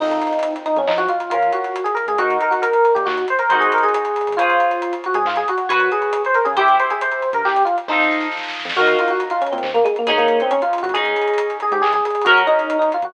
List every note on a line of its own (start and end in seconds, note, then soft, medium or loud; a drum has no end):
0.00 0.20 F2 medium
0.00 0.53 D#4 loud
0.00 1.29 D#4 medium
0.00 1.29 F4 medium
0.00 1.29 A4 medium
0.00 kick loud
0.00 crash loud
0.04 1.29 C4 medium
0.11 closed hi-hat medium
0.22 closed hi-hat medium
0.27 closed hi-hat medium
0.33 closed hi-hat medium
0.39 closed hi-hat medium
0.43 closed hi-hat loud
0.56 closed hi-hat medium
0.66 0.76 D#4 medium
0.66 closed hi-hat medium
0.76 0.86 F2 medium
0.76 0.89 C#4 medium
0.76 closed hi-hat medium
0.87 1.08 F3 medium
0.87 0.98 D#4 medium
0.87 clap loud
0.98 1.08 F#4 loud
0.98 closed hi-hat medium
1.08 1.30 F4 medium
1.08 closed hi-hat medium
1.20 closed hi-hat medium
1.30 1.51 C#2 loud
1.30 2.17 C#4 medium
1.30 1.51 F4 medium
1.30 2.17 F4 medium
1.30 2.17 A#4 medium
1.30 closed hi-hat medium
1.42 closed hi-hat medium
1.52 1.82 F#4 medium
1.52 closed hi-hat medium
1.64 closed hi-hat medium
1.76 closed hi-hat medium
1.84 1.95 G#4 medium
1.84 closed hi-hat medium
1.95 2.05 A#4 medium
1.95 closed hi-hat medium
2.07 2.17 C#2 medium
2.07 2.19 G#4 medium
2.07 closed hi-hat medium
2.18 2.38 D#2 loud
2.18 3.47 D#4 medium
2.18 2.36 F#4 loud
2.18 3.47 F#4 medium
2.18 3.47 A#4 medium
2.18 kick medium
2.18 closed hi-hat medium
2.30 closed hi-hat medium
2.41 2.52 A#4 medium
2.41 closed hi-hat medium
2.51 2.61 F#4 medium
2.51 closed hi-hat medium
2.62 2.93 A#4 medium
2.62 closed hi-hat medium
2.73 closed hi-hat medium
2.85 closed hi-hat medium
2.95 3.06 A#2 medium
2.95 3.05 G4 medium
2.95 closed hi-hat medium
3.06 3.26 D#2 medium
3.06 3.25 F#4 medium
3.06 clap loud
3.18 closed hi-hat medium
3.28 3.41 C5 medium
3.28 closed hi-hat medium
3.39 3.57 A#4 medium
3.39 closed hi-hat medium
3.50 3.69 G#1 medium
3.50 4.35 D#4 medium
3.50 4.35 F#4 medium
3.50 4.35 G#4 medium
3.50 4.35 C5 medium
3.50 closed hi-hat medium
3.60 3.71 G#4 medium
3.60 closed hi-hat medium
3.72 3.84 A#4 medium
3.72 closed hi-hat medium
3.78 closed hi-hat medium
3.83 3.94 G#4 medium
3.83 closed hi-hat medium
3.88 closed hi-hat medium
3.94 4.36 G#4 medium
3.94 closed hi-hat loud
4.05 closed hi-hat medium
4.16 closed hi-hat medium
4.21 closed hi-hat medium
4.27 4.38 G#1 medium
4.27 closed hi-hat medium
4.32 closed hi-hat medium
4.37 4.58 C#2 loud
4.37 4.94 F4 medium
4.37 5.67 G#4 medium
4.37 5.67 C5 medium
4.37 5.67 C#5 medium
4.37 kick medium
4.37 closed hi-hat loud
4.42 5.67 F4 medium
4.50 closed hi-hat medium
4.60 closed hi-hat medium
4.71 closed hi-hat medium
4.82 closed hi-hat medium
4.93 closed hi-hat medium
5.04 5.16 F#4 medium
5.04 closed hi-hat medium
5.14 5.24 C#2 medium
5.14 5.25 G#4 loud
5.14 closed hi-hat medium
5.25 5.45 G#2 medium
5.25 5.37 F4 medium
5.25 clap loud
5.36 5.47 G#4 loud
5.36 closed hi-hat medium
5.48 5.69 F#4 medium
5.48 closed hi-hat medium
5.58 closed hi-hat medium
5.69 5.90 F#2 medium
5.69 5.90 F#4 medium
5.69 6.55 F#4 medium
5.69 6.55 B4 medium
5.69 6.55 C#5 medium
5.69 closed hi-hat loud
5.80 closed hi-hat medium
5.92 6.22 G#4 medium
5.92 closed hi-hat medium
6.02 closed hi-hat medium
6.13 closed hi-hat loud
6.25 6.36 C5 medium
6.25 closed hi-hat medium
6.34 6.45 A#4 medium
6.34 closed hi-hat medium
6.45 6.56 C#3 medium
6.45 6.55 G#4 medium
6.45 closed hi-hat medium
6.57 6.77 C2 loud
6.57 7.85 E4 medium
6.57 6.76 G4 loud
6.57 7.85 G4 medium
6.57 7.85 C5 medium
6.57 kick loud
6.57 closed hi-hat medium
6.68 closed hi-hat medium
6.80 6.90 C5 medium
6.80 closed hi-hat medium
6.90 7.01 G#4 medium
6.90 closed hi-hat medium
7.01 7.29 C5 medium
7.01 closed hi-hat medium
7.11 closed hi-hat medium
7.22 closed hi-hat medium
7.33 7.43 G2 medium
7.33 7.45 A#4 medium
7.33 closed hi-hat medium
7.44 7.64 C2 medium
7.44 7.63 G4 loud
7.44 clap medium
7.56 closed hi-hat medium
7.65 7.75 F4 medium
7.65 closed hi-hat medium
7.78 closed hi-hat medium
7.88 8.08 F2 medium
7.88 8.27 D#4 medium
7.88 8.74 F4 medium
7.88 8.74 A4 medium
7.88 8.74 C5 medium
7.88 kick medium
7.88 snare medium
7.92 8.74 D#4 medium
8.00 snare medium
8.11 snare medium
8.21 snare medium
8.31 snare medium
8.37 snare medium
8.43 snare medium
8.48 snare medium
8.54 snare medium
8.60 snare medium
8.65 8.75 F2 medium
8.65 snare medium
8.69 snare loud
8.75 8.96 D#2 medium
8.75 10.05 F4 medium
8.75 8.97 F#4 loud
8.75 10.05 F#4 medium
8.75 10.05 A#4 medium
8.75 kick loud
8.75 crash medium
8.80 10.05 D#4 medium
8.87 closed hi-hat medium
8.99 9.11 F4 medium
8.99 closed hi-hat medium
9.08 9.21 F#4 medium
9.08 closed hi-hat medium
9.20 closed hi-hat medium
9.30 9.41 F4 medium
9.30 closed hi-hat medium
9.41 9.52 C#4 medium
9.41 closed hi-hat medium
9.47 closed hi-hat medium
9.52 9.63 A#2 medium
9.52 9.69 C4 medium
9.52 closed hi-hat medium
9.58 closed hi-hat medium
9.63 9.84 D#2 medium
9.63 clap medium
9.74 9.85 A#3 loud
9.74 closed hi-hat medium
9.85 9.95 G#3 loud
9.85 closed hi-hat medium
9.96 10.09 A#3 medium
9.96 closed hi-hat medium
10.07 10.27 G#1 loud
10.07 10.18 G#3 medium
10.07 10.93 C#4 medium
10.07 10.93 D#4 medium
10.07 10.93 G#4 loud
10.07 closed hi-hat medium
10.18 10.39 A#3 medium
10.18 closed hi-hat medium
10.28 closed hi-hat medium
10.40 10.52 C4 medium
10.40 closed hi-hat medium
10.51 10.61 C#4 loud
10.51 closed hi-hat medium
10.62 10.82 F4 medium
10.62 closed hi-hat medium
10.73 closed hi-hat medium
10.78 closed hi-hat medium
10.83 10.93 G#1 medium
10.83 10.93 F#4 medium
10.83 closed hi-hat medium
10.89 closed hi-hat medium
10.94 11.14 C#2 loud
10.94 12.23 C#4 medium
10.94 12.23 D#4 medium
10.94 11.58 G#4 loud
10.94 12.23 G#4 medium
10.94 kick medium
10.94 closed hi-hat medium
11.05 closed hi-hat medium
11.16 closed hi-hat medium
11.22 closed hi-hat medium
11.28 closed hi-hat medium
11.34 closed hi-hat medium
11.38 closed hi-hat loud
11.50 closed hi-hat medium
11.60 11.73 G#4 medium
11.60 closed hi-hat medium
11.71 11.81 G#2 medium
11.71 11.83 G4 loud
11.71 closed hi-hat medium
11.82 12.01 C#2 medium
11.82 11.92 G#4 loud
11.82 clap loud
11.93 12.04 G#4 loud
11.93 closed hi-hat medium
12.05 12.25 G#4 medium
12.05 closed hi-hat medium
12.10 closed hi-hat medium
12.15 closed hi-hat medium
12.22 12.43 F#4 medium
12.22 closed hi-hat medium
12.26 12.46 F#2 loud
12.26 13.13 C#4 medium
12.26 13.13 F#4 medium
12.26 13.13 A#4 medium
12.26 closed hi-hat loud
12.37 closed hi-hat medium
12.47 12.76 D#4 loud
12.47 closed hi-hat medium
12.59 closed hi-hat medium
12.70 closed hi-hat medium
12.79 12.90 D#4 medium
12.79 closed hi-hat medium
12.92 13.04 F4 medium
12.92 closed hi-hat medium
13.02 13.12 F#2 medium
13.02 13.13 F#4 medium
13.02 closed hi-hat medium